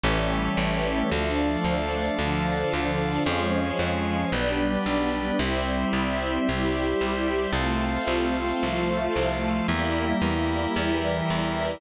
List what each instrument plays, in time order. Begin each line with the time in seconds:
0.04 electric bass (finger) A1, string ensemble 1 E3 G3 A3 C#4, drawbar organ G4 A4 C#5 E5
0.57 electric bass (finger) A1
1.10 electric bass (finger) D2, string ensemble 1 F3 A3 D4, drawbar organ A4 D5 F5
1.65 electric bass (finger) D2
2.18 electric bass (finger) D2, string ensemble 1 D3 F3 D4
2.73 electric bass (finger) D2
3.25 electric bass (finger) F2, string ensemble 1 F3 G#3 C#4, drawbar organ G#4 C#5 F5
3.79 electric bass (finger) F2
4.32 electric bass (finger) B1, string ensemble 1 G3 B3 D4, drawbar organ G4 B4 D5
4.86 electric bass (finger) B1
5.39 electric bass (finger) C2, string ensemble 1 G3 C4 E4, drawbar organ G4 C5 E5
5.93 electric bass (finger) C2
6.48 electric bass (finger) C2, string ensemble 1 G3 E4 G4
7.01 electric bass (finger) C2
7.53 electric bass (finger) C2, string ensemble 1 A3 C4 F4, drawbar organ A4 C5 F5
8.08 electric bass (finger) C2
8.62 electric bass (finger) C2, string ensemble 1 F3 A3 F4
9.16 electric bass (finger) C2
9.68 electric bass (finger) E2, string ensemble 1 G3 A#3 E4, drawbar organ G4 A#4 E5
10.22 electric bass (finger) E2
10.75 electric bass (finger) E2, string ensemble 1 E3 G3 E4
11.30 electric bass (finger) E2